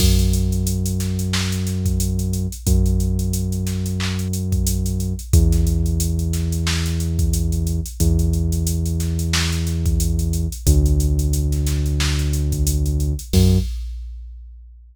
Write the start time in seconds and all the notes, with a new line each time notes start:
0.00 F#2, kick, crash
0.19 closed hi-hat
0.33 closed hi-hat
0.52 closed hi-hat
0.67 closed hi-hat
0.86 closed hi-hat
1.00 snare, closed hi-hat
1.19 closed hi-hat
1.33 snare
1.52 closed hi-hat
1.67 snare, closed hi-hat
1.86 kick, closed hi-hat
2.00 closed hi-hat
2.19 closed hi-hat
2.33 closed hi-hat
2.52 closed hi-hat
2.67 F#2, kick, closed hi-hat
2.86 closed hi-hat
3.00 closed hi-hat
3.19 closed hi-hat
3.33 closed hi-hat
3.52 closed hi-hat
3.67 snare, closed hi-hat
3.86 closed hi-hat
4.00 clap
4.19 closed hi-hat
4.33 closed hi-hat
4.52 kick, closed hi-hat
4.67 closed hi-hat
4.86 closed hi-hat
5.00 closed hi-hat
5.19 closed hi-hat
5.33 E2, kick, closed hi-hat
5.52 snare, closed hi-hat
5.67 closed hi-hat
5.86 closed hi-hat
6.00 closed hi-hat
6.19 closed hi-hat
6.33 snare, closed hi-hat
6.52 closed hi-hat
6.67 snare
6.86 closed hi-hat
7.00 closed hi-hat
7.19 kick, closed hi-hat
7.33 closed hi-hat
7.52 closed hi-hat
7.67 closed hi-hat
7.86 closed hi-hat
8.00 E2, kick, closed hi-hat
8.19 closed hi-hat
8.33 closed hi-hat
8.52 closed hi-hat
8.67 closed hi-hat
8.86 closed hi-hat
9.00 snare, closed hi-hat
9.19 closed hi-hat
9.33 snare
9.52 closed hi-hat
9.67 snare, closed hi-hat
9.86 kick, closed hi-hat
10.00 closed hi-hat
10.19 closed hi-hat
10.33 closed hi-hat
10.52 closed hi-hat
10.67 D2, kick, closed hi-hat
10.86 closed hi-hat
11.00 closed hi-hat
11.19 closed hi-hat
11.33 closed hi-hat
11.52 snare, closed hi-hat
11.67 snare, closed hi-hat
11.86 closed hi-hat
12.00 snare
12.19 closed hi-hat
12.33 closed hi-hat
12.52 kick, closed hi-hat
12.67 closed hi-hat
12.86 closed hi-hat
13.00 closed hi-hat
13.19 closed hi-hat
13.33 F#2, kick, crash